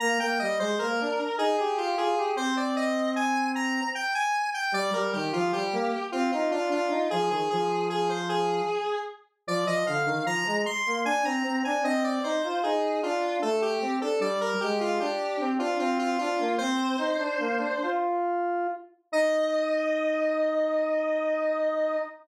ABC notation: X:1
M:3/4
L:1/16
Q:1/4=76
K:Eb
V:1 name="Lead 1 (square)"
b g e c B3 A A G A2 | c d e2 a2 b2 g a2 g | d B G F G3 F F F F2 | A A A2 A c A4 z2 |
d e f2 b2 c'2 a b2 a | e d c2 A2 F2 =A G2 A | d B G F G3 F F F F2 | "^rit." c8 z4 |
e12 |]
V:2 name="Lead 1 (square)"
B, B, G, A, B, D z E G F F G | C8 z4 | G, G, E, F, G, B, z C E D D E | F, E, F,6 z4 |
F, F, D, E, F, A, z B, D C C D | C2 E F E2 D2 =A,2 C D | G,2 A,2 D2 C D C2 D B, | "^rit." C2 E D B, D F4 z2 |
E12 |]